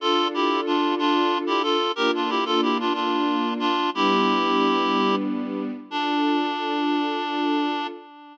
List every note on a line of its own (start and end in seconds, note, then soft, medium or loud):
0.00 1.76 D4 loud
0.00 1.76 F4 loud
0.00 0.28 F4 medium
0.00 1.76 A4 loud
0.00 0.28 A4 loud
0.34 0.61 E4 medium
0.34 0.61 G4 medium
0.66 0.95 D4 medium
0.66 0.95 F4 medium
0.99 1.38 D4 medium
0.99 1.38 F4 medium
1.47 1.62 E4 medium
1.47 1.62 G4 medium
1.63 1.92 F4 medium
1.63 1.92 A4 medium
1.96 3.74 A#3 loud
1.96 3.74 D4 loud
1.96 3.74 F4 loud
1.96 2.11 G4 medium
1.96 2.11 A#4 loud
2.15 2.30 D4 medium
2.15 2.30 F4 medium
2.29 2.44 E4 medium
2.29 2.44 G4 medium
2.45 2.61 F4 medium
2.45 2.61 A4 medium
2.62 2.78 E4 medium
2.62 2.78 G4 medium
2.80 2.93 D4 medium
2.80 2.93 F4 medium
2.94 3.54 D4 medium
2.94 3.54 F4 medium
3.59 3.90 D4 medium
3.59 3.90 F4 medium
3.94 5.71 G3 loud
3.94 5.71 B3 loud
3.94 5.71 D4 loud
3.94 5.16 E4 medium
3.94 5.16 G4 loud
5.90 7.87 D4 medium
5.90 7.87 D4 loud
5.90 7.87 F4 loud
5.90 7.87 A4 medium